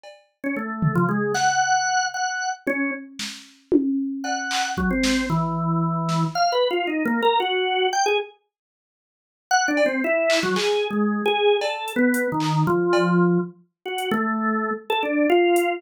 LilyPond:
<<
  \new Staff \with { instrumentName = "Drawbar Organ" } { \time 2/4 \tempo 4 = 114 r8. des'16 a8. f16 | aes8 ges''4. | ges''8. r16 des'8 r8 | r2 |
ges''4 ges16 c'8. | e2 | \tuplet 3/2 { f''8 b'8 f'8 ees'8 bes8 bes'8 } | ges'4 g''16 aes'16 r8 |
r2 | \tuplet 3/2 { ges''8 d'8 c'8 } e'8. ges16 | \tuplet 3/2 { aes'4 aes4 aes'4 } | \tuplet 3/2 { a'4 b4 ees4 } |
f4. r8 | r16 ges'8 a4~ a16 | r16 a'16 d'8 f'4 | }
  \new DrumStaff \with { instrumentName = "Drums" } \drummode { \time 2/4 cb4 r8 tomfh8 | r8 sn8 r4 | r4 tommh4 | sn4 tommh4 |
cb8 hc8 bd8 sn8 | r4 r8 sn8 | r4 r4 | r4 r4 |
r4 r4 | r8 cb8 r8 hc8 | hc4 r4 | cb8 hh8 hh8 hc8 |
r8 cb8 r4 | r8 hh8 r4 | r4 r8 hh8 | }
>>